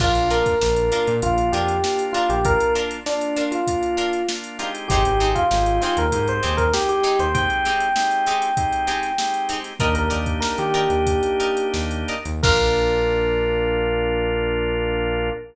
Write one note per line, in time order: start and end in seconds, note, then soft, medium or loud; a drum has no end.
0.00 0.15 A#1 loud
0.00 0.55 A#3 medium
0.00 0.11 D4 loud
0.00 0.55 D4 medium
0.00 0.55 F4 medium
0.00 0.11 F4 loud
0.00 0.28 F4 loud
0.00 0.11 A#4 medium
0.00 kick medium
0.00 crash medium
0.15 0.43 A#1 medium
0.15 closed hi-hat medium
0.30 0.52 D4 medium
0.30 0.52 F4 medium
0.30 1.14 A#4 loud
0.30 0.52 A#4 loud
0.30 closed hi-hat medium
0.46 kick medium
0.46 closed hi-hat medium
0.61 0.90 A#1 loud
0.61 1.17 A#3 medium
0.61 1.17 D4 medium
0.61 1.17 F4 medium
0.61 snare medium
0.76 closed hi-hat medium
0.92 1.13 D4 medium
0.92 1.13 F4 medium
0.92 1.13 A#4 loud
0.92 closed hi-hat medium
1.07 1.21 A#2 loud
1.07 closed hi-hat medium
1.22 1.50 A#1 medium
1.22 1.78 A#3 medium
1.22 1.78 D4 medium
1.22 1.78 F4 medium
1.22 1.48 F4 loud
1.22 kick medium
1.22 closed hi-hat medium
1.38 closed hi-hat medium
1.52 1.80 F2 medium
1.52 1.75 D4 medium
1.52 1.75 F4 medium
1.52 2.03 G4 loud
1.52 1.75 A#4 medium
1.52 closed hi-hat medium
1.68 closed hi-hat medium
1.83 2.39 A#3 medium
1.83 2.39 D4 medium
1.83 2.39 F4 medium
1.83 snare medium
1.99 closed hi-hat medium
2.13 2.36 D4 loud
2.13 2.27 F4 loud
2.13 2.36 F4 medium
2.13 2.36 A#4 medium
2.13 closed hi-hat medium
2.30 2.57 A#1 loud
2.30 2.44 G4 loud
2.30 closed hi-hat medium
2.45 3.00 A#3 medium
2.45 3.00 D4 medium
2.45 3.00 F4 medium
2.45 2.73 A#4 loud
2.45 kick medium
2.45 closed hi-hat medium
2.60 closed hi-hat medium
2.75 2.97 D4 medium
2.75 2.97 F4 medium
2.75 2.97 A#4 loud
2.75 closed hi-hat medium
2.91 closed hi-hat medium
3.06 3.61 A#3 medium
3.06 3.61 D4 medium
3.06 3.44 D4 loud
3.06 3.61 F4 medium
3.06 snare medium
3.21 closed hi-hat medium
3.36 3.58 D4 medium
3.36 3.58 F4 medium
3.36 3.58 A#4 medium
3.36 closed hi-hat medium
3.52 4.26 F4 medium
3.52 closed hi-hat medium
3.67 4.23 A#3 medium
3.67 4.23 D4 medium
3.67 4.23 F4 medium
3.67 kick medium
3.67 closed hi-hat medium
3.83 closed hi-hat medium
3.97 4.19 D4 medium
3.97 4.19 F4 medium
3.97 4.19 A#4 medium
3.97 closed hi-hat medium
4.13 closed hi-hat medium
4.29 4.58 A#3 medium
4.29 4.58 D4 medium
4.29 4.58 F4 medium
4.29 snare loud
4.44 closed hi-hat medium
4.59 5.45 G#3 medium
4.59 5.45 C4 medium
4.59 4.70 D4 medium
4.59 5.45 D#4 medium
4.59 4.70 F4 medium
4.59 5.45 G4 medium
4.59 4.70 A#4 medium
4.59 closed hi-hat medium
4.75 closed hi-hat medium
4.88 5.04 G#1 loud
4.88 5.01 C4 loud
4.88 5.01 D#4 loud
4.88 5.29 G4 loud
4.88 5.01 G4 loud
4.88 5.01 G#4 medium
4.88 kick medium
4.88 closed hi-hat medium
5.05 5.34 G#1 loud
5.05 closed hi-hat medium
5.20 5.42 C4 medium
5.20 5.42 D#4 medium
5.20 5.42 G4 medium
5.20 5.42 G#4 medium
5.20 closed hi-hat medium
5.35 5.79 F4 loud
5.35 kick medium
5.35 closed hi-hat medium
5.51 5.79 G#1 loud
5.51 6.06 G#3 medium
5.51 6.06 C4 medium
5.51 6.06 D#4 medium
5.51 6.06 G4 medium
5.51 snare medium
5.66 closed hi-hat medium
5.81 6.04 C4 loud
5.81 6.04 D#4 medium
5.81 5.96 F4 loud
5.81 6.04 G4 medium
5.81 6.04 G#4 medium
5.81 closed hi-hat medium
5.97 6.11 D#2 loud
5.97 6.28 A#4 loud
5.97 closed hi-hat medium
6.12 6.40 G#2 medium
6.12 6.67 G#3 medium
6.12 6.67 C4 medium
6.12 6.67 D#4 medium
6.12 6.67 G4 medium
6.12 kick medium
6.12 closed hi-hat medium
6.28 6.56 C5 loud
6.28 closed hi-hat medium
6.43 6.72 D#2 loud
6.43 6.64 C4 medium
6.43 6.64 D#4 medium
6.43 6.64 G4 medium
6.43 6.64 G#4 medium
6.43 closed hi-hat medium
6.57 6.72 A#4 loud
6.57 kick medium
6.57 closed hi-hat medium
6.73 7.29 G#3 medium
6.73 7.29 C4 medium
6.73 7.29 D#4 medium
6.73 6.88 G4 loud
6.73 7.29 G4 medium
6.73 snare loud
6.89 7.19 G4 loud
6.89 closed hi-hat medium
7.03 7.25 C4 medium
7.03 7.25 D#4 loud
7.03 7.25 G4 medium
7.03 7.25 G#4 medium
7.03 closed hi-hat medium
7.19 7.47 D#2 medium
7.19 7.34 C5 loud
7.19 closed hi-hat medium
7.34 7.89 G#3 medium
7.34 7.89 C4 medium
7.34 7.89 D#4 medium
7.34 7.89 G4 medium
7.34 9.44 G5 loud
7.34 kick medium
7.34 closed hi-hat medium
7.50 closed hi-hat soft
7.65 7.87 C4 medium
7.65 7.87 D#4 medium
7.65 7.87 G4 medium
7.65 7.87 G#4 medium
7.65 snare soft
7.65 closed hi-hat medium
7.80 closed hi-hat medium
7.96 8.51 G#3 medium
7.96 8.51 C4 medium
7.96 8.51 D#4 medium
7.96 8.51 G4 medium
7.96 snare loud
8.11 closed hi-hat medium
8.26 8.48 C4 medium
8.26 8.48 D#4 medium
8.26 8.48 G4 medium
8.26 8.48 G#4 medium
8.26 closed hi-hat medium
8.42 snare soft
8.42 closed hi-hat medium
8.57 9.12 G#3 medium
8.57 9.12 C4 medium
8.57 9.12 D#4 medium
8.57 9.12 G4 medium
8.57 kick medium
8.57 closed hi-hat medium
8.73 closed hi-hat medium
8.87 9.09 C4 medium
8.87 9.09 D#4 medium
8.87 9.09 G4 loud
8.87 9.09 G#4 medium
8.87 closed hi-hat medium
9.03 snare soft
9.03 closed hi-hat medium
9.18 9.74 G#3 medium
9.18 9.74 C4 medium
9.18 9.74 D#4 medium
9.18 9.74 G4 medium
9.18 snare loud
9.34 closed hi-hat medium
9.49 9.60 C4 medium
9.49 9.60 D#4 medium
9.49 9.60 G4 medium
9.49 9.60 G#4 medium
9.49 closed hi-hat medium
9.64 snare soft
9.64 closed hi-hat medium
9.80 10.09 D#2 loud
9.80 12.15 A#3 medium
9.80 12.15 D4 medium
9.80 12.15 D#4 medium
9.80 12.15 G4 medium
9.80 9.91 A#4 medium
9.80 9.95 A#4 loud
9.80 9.91 D5 medium
9.80 9.91 D#5 loud
9.80 9.91 G5 loud
9.80 kick medium
9.80 closed hi-hat medium
9.95 10.10 A#4 loud
9.95 closed hi-hat medium
10.10 10.40 D#2 medium
10.10 10.32 A#4 medium
10.10 10.32 D5 loud
10.10 10.32 D#5 medium
10.10 10.32 G5 medium
10.10 closed hi-hat medium
10.26 kick medium
10.26 closed hi-hat medium
10.40 10.55 A#4 loud
10.40 snare loud
10.58 10.87 D#3 medium
10.58 11.67 G4 loud
10.58 closed hi-hat medium
10.74 10.97 A#4 loud
10.74 10.97 D5 loud
10.74 10.97 D#5 medium
10.74 10.97 G5 medium
10.74 closed hi-hat medium
10.90 11.19 D#2 medium
10.90 closed hi-hat medium
11.07 kick medium
11.07 closed hi-hat medium
11.23 closed hi-hat medium
11.40 11.63 A#4 medium
11.40 11.63 D5 medium
11.40 11.63 D#5 medium
11.40 11.63 G5 medium
11.40 closed hi-hat medium
11.57 closed hi-hat medium
11.74 12.05 D#2 medium
11.74 snare medium
11.91 closed hi-hat medium
12.08 12.21 A#4 medium
12.08 12.21 D5 medium
12.08 12.21 D#5 medium
12.08 12.21 G5 medium
12.08 closed hi-hat medium
12.25 12.42 D#2 loud
12.25 closed hi-hat medium
12.43 15.31 A#1 medium
12.43 15.30 A#3 loud
12.43 15.30 D4 loud
12.43 15.30 F4 loud
12.43 15.29 A#4 loud
12.43 15.30 A#4 loud
12.43 kick loud
12.43 crash loud